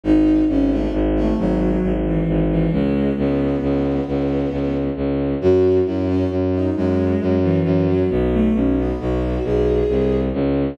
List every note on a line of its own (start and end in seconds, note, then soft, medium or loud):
0.04 0.42 G#1 medium
0.04 0.43 D#4 medium
0.48 0.86 G#1 medium
0.48 0.70 C#4 medium
0.71 0.92 A3 medium
0.93 1.31 G#1 medium
1.15 1.37 A3 medium
1.38 1.76 G#1 medium
1.38 1.92 F#3 medium
1.83 2.21 G#1 medium
2.05 2.44 E3 medium
2.27 2.65 G#1 medium
2.50 2.71 E3 medium
2.72 3.10 C#2 medium
2.72 3.13 G#3 medium
3.17 3.55 C#2 medium
3.17 4.75 B3 medium
3.62 4.00 C#2 medium
4.08 4.46 C#2 medium
4.51 4.89 C#2 medium
4.96 5.34 C#2 medium
5.41 5.79 F#2 loud
5.41 5.78 F#4 medium
5.86 6.24 F#2 medium
5.86 6.07 E4 medium
6.08 6.30 C#4 medium
6.30 6.68 F#2 medium
6.53 6.75 D#4 medium
6.76 7.15 F#2 medium
6.76 7.35 G#3 medium
7.21 7.59 F#2 medium
7.43 7.86 E3 medium
7.65 8.03 F#2 medium
7.88 8.09 F#3 medium
8.10 8.48 B1 medium
8.10 8.31 B3 medium
8.33 8.54 A3 medium
8.54 8.92 B1 medium
8.54 8.76 C#4 medium
8.77 8.99 B3 medium
8.99 9.38 B1 medium
8.99 9.43 F#4 medium
9.44 9.82 B1 medium
9.44 10.16 G#4 medium
9.89 10.29 C2 medium
10.33 10.74 C#2 medium